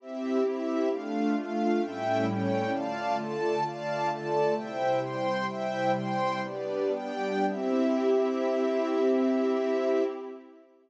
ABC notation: X:1
M:2/2
L:1/8
Q:1/2=66
K:C
V:1 name="Pad 5 (bowed)"
[CEG]4 [A,DF]4 | [A,,G,^CE]4 [D,A,F]4 | [D,A,F]4 [C,G,E]4 | "^rit." [C,G,E]4 [G,B,D]4 |
[CEG]8 |]
V:2 name="String Ensemble 1"
[CGe]2 [CEe]2 [A,Df]2 [A,Ff]2 | [A,^Ceg]2 [A,C^cg]2 [dfa]2 [Ada]2 | [dfa]2 [Ada]2 [ceg]2 [cgc']2 | "^rit." [ceg]2 [cgc']2 [GBd]2 [Gdg]2 |
[CGe]8 |]